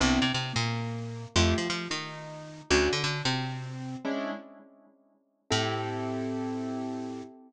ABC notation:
X:1
M:4/4
L:1/8
Q:"Swing" 1/4=178
K:Am
V:1 name="Acoustic Grand Piano"
[B,CDE] C C _B,5 | [A,EFG] F F _E5 | [A,^CD^F] D D =C5 | "^rit." [^G,^CDE]5 z3 |
[CEGA]8 |]
V:2 name="Electric Bass (finger)" clef=bass
C,, C, C, _B,,5 | F,, F, F, _E,5 | D,, D, D, C,5 | "^rit." z8 |
A,,8 |]